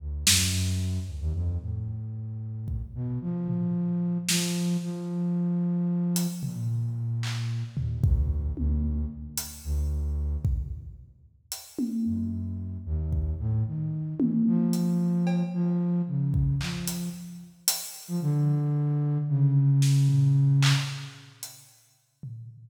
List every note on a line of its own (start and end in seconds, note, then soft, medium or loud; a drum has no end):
0.00 0.24 D2 medium
0.27 0.99 F#2 loud
0.27 snare loud
1.07 1.19 D2 medium
1.21 1.33 D#2 loud
1.34 1.58 F2 loud
1.61 2.81 A2 medium
2.68 kick medium
2.95 3.19 B2 medium
3.21 4.18 F3 medium
3.48 floor tom medium
4.29 4.77 F3 loud
4.29 snare loud
4.82 6.27 F3 medium
6.16 closed hi-hat medium
6.43 7.63 A#2 medium
6.43 floor tom medium
7.23 clap medium
7.77 8.01 D#2 medium
7.77 floor tom medium
8.03 8.52 D2 loud
8.03 kick loud
8.57 9.05 D2 loud
8.57 high tom medium
9.37 closed hi-hat medium
9.64 10.37 D2 loud
10.45 kick medium
11.52 closed hi-hat medium
11.79 high tom medium
12.05 12.78 F#2 medium
12.86 13.34 D#2 loud
13.12 kick medium
13.39 13.63 A2 loud
13.66 14.14 D#3 medium
14.20 14.44 E3 medium
14.20 high tom loud
14.46 15.43 F3 loud
14.73 closed hi-hat medium
15.27 cowbell medium
15.54 16.02 F3 loud
16.07 16.55 C#3 medium
16.34 kick medium
16.61 17.09 F3 medium
16.61 clap medium
16.87 closed hi-hat medium
17.68 closed hi-hat loud
18.08 18.20 F3 loud
18.21 19.18 D3 loud
19.29 20.73 C#3 loud
19.82 snare medium
20.09 floor tom medium
20.62 clap loud
21.43 closed hi-hat medium
22.23 floor tom medium